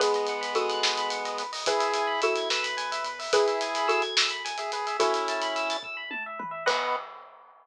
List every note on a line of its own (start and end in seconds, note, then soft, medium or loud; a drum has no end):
0.00 0.23 B1 loud
0.00 1.43 G#3 loud
0.00 1.43 B3 loud
0.00 0.51 G#4 medium
0.00 0.51 B4 medium
0.00 0.13 B4 medium
0.00 kick loud
0.00 closed hi-hat loud
0.14 0.28 D#5 medium
0.14 closed hi-hat medium
0.27 0.52 B1 loud
0.27 0.42 F#5 medium
0.27 closed hi-hat medium
0.41 0.54 B5 medium
0.41 closed hi-hat medium
0.55 0.78 B1 loud
0.55 1.56 F#4 medium
0.55 1.56 A4 medium
0.55 0.68 D#6 medium
0.55 closed hi-hat medium
0.69 0.82 F#6 medium
0.69 closed hi-hat medium
0.83 1.07 B1 loud
0.83 0.96 D#6 medium
0.83 snare loud
0.98 1.10 B5 medium
0.98 closed hi-hat medium
1.10 1.36 B1 loud
1.10 1.23 F#5 medium
1.10 closed hi-hat medium
1.25 1.38 D#5 medium
1.25 closed hi-hat medium
1.38 1.63 B1 loud
1.38 1.51 B4 medium
1.38 closed hi-hat medium
1.53 1.65 D#5 medium
1.53 open hi-hat medium
1.66 1.91 E2 loud
1.66 2.21 E4 medium
1.66 2.21 G#4 loud
1.66 2.16 G#4 medium
1.66 2.16 B4 medium
1.66 1.81 B4 medium
1.66 kick loud
1.66 closed hi-hat loud
1.80 1.92 E5 medium
1.80 closed hi-hat medium
1.94 2.18 E2 loud
1.94 2.07 G#5 medium
1.94 closed hi-hat medium
2.07 2.20 B5 medium
2.21 2.46 E2 loud
2.21 2.49 E4 medium
2.21 3.14 F#4 medium
2.21 3.14 A4 medium
2.21 2.34 E6 medium
2.21 closed hi-hat medium
2.36 2.50 G#6 medium
2.36 closed hi-hat medium
2.50 2.74 E2 loud
2.50 3.19 B4 medium
2.50 2.63 E6 medium
2.50 snare loud
2.63 2.76 B5 medium
2.63 closed hi-hat medium
2.77 3.00 E2 loud
2.77 2.90 G#5 medium
2.77 closed hi-hat medium
2.92 3.04 E5 medium
2.92 closed hi-hat medium
3.04 3.28 E2 loud
3.04 3.19 B4 medium
3.04 closed hi-hat medium
3.19 3.32 E5 medium
3.19 open hi-hat medium
3.32 3.56 G#1 loud
3.32 4.03 E4 medium
3.32 3.86 G#4 medium
3.32 4.03 G#4 loud
3.32 3.86 B4 medium
3.32 3.46 B4 medium
3.32 kick loud
3.32 closed hi-hat loud
3.47 3.60 E5 medium
3.47 closed hi-hat medium
3.61 3.84 G#1 medium
3.61 3.74 G#5 medium
3.61 closed hi-hat medium
3.75 3.88 B5 medium
3.75 closed hi-hat medium
3.88 4.11 G#1 medium
3.88 4.91 F#4 medium
3.88 4.91 A4 medium
3.88 4.00 E6 medium
3.88 closed hi-hat medium
4.02 4.15 G#6 medium
4.02 closed hi-hat medium
4.17 4.41 G#1 loud
4.17 4.30 E6 medium
4.17 snare loud
4.30 4.43 B5 medium
4.30 closed hi-hat medium
4.45 4.69 G#1 loud
4.45 4.57 G#5 medium
4.45 closed hi-hat medium
4.58 4.72 G#4 medium
4.58 4.70 E5 medium
4.58 closed hi-hat medium
4.72 4.95 G#1 medium
4.72 4.97 G#4 medium
4.72 4.85 B4 medium
4.72 closed hi-hat medium
4.87 4.99 E5 medium
4.87 closed hi-hat medium
5.00 5.77 C#4 loud
5.00 5.77 E4 loud
5.00 6.28 F#4 medium
5.00 6.28 A4 medium
5.00 5.13 B4 medium
5.00 kick loud
5.00 closed hi-hat loud
5.14 5.26 E5 medium
5.14 closed hi-hat medium
5.28 5.41 A5 medium
5.28 closed hi-hat medium
5.42 5.54 B5 medium
5.42 closed hi-hat medium
5.56 5.68 E6 medium
5.56 closed hi-hat medium
5.70 5.83 A6 medium
5.70 closed hi-hat medium
5.83 5.96 E6 medium
5.83 kick loud
5.97 6.09 B5 medium
6.11 6.23 A5 medium
6.11 high tom medium
6.26 6.39 E5 medium
6.39 6.52 B4 medium
6.39 mid tom loud
6.51 6.64 E5 medium
6.66 6.96 B1 medium
6.66 6.96 B3 loud
6.66 6.95 B4 loud
6.66 6.96 B4 loud
6.66 6.95 D#5 loud
6.66 6.95 F#5 loud
6.66 kick loud
6.66 crash loud